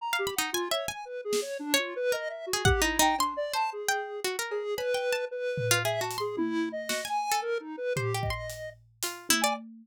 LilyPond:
<<
  \new Staff \with { instrumentName = "Harpsichord" } { \time 3/4 \tempo 4 = 113 r16 f''16 b''16 dis'16 \tuplet 3/2 { gis''8 e''8 gis''8 } r4 | r16 cis''8 r16 ais'8. gis'16 \tuplet 3/2 { fis''8 dis'8 dis'8 } | \tuplet 3/2 { c'''4 c''4 g''4 } fis'16 ais'8 r16 | \tuplet 3/2 { b''8 g''8 a''8 } r8. f'16 \tuplet 3/2 { gis'8 fis'8 c'''8 } |
r4 fis'16 gis''8 a'8. r8 | \tuplet 3/2 { c''8 g'8 c'''8 } r4 f'8 e'16 d''16 | }
  \new Staff \with { instrumentName = "Lead 1 (square)" } { \time 3/4 \tuplet 3/2 { ais''8 g'8 fis''8 f'8 cis''8 gis''8 b'8 gis'8 cis''8 } | \tuplet 3/2 { d'8 f'8 b'8 dis''8 e''8 fis'8 g'8 e'8 g''8 } | \tuplet 3/2 { d'8 d''8 a''8 } gis'4 r8 gis'8 | b'4 b'4 \tuplet 3/2 { e''8 a''8 gis'8 } |
\tuplet 3/2 { e'4 dis''4 gis''4 ais'8 dis'8 b'8 } | g'8 dis''4 r4 r16 gis''16 | }
  \new DrumStaff \with { instrumentName = "Drums" } \drummode { \time 3/4 r4 r4 r8 sn8 | r4 r4 bd4 | cb4 r4 r8 cb8 | cb4 r8 tomfh8 r8 hh8 |
tommh4 sn4 r4 | tomfh8 bd8 hh4 hh8 tommh8 | }
>>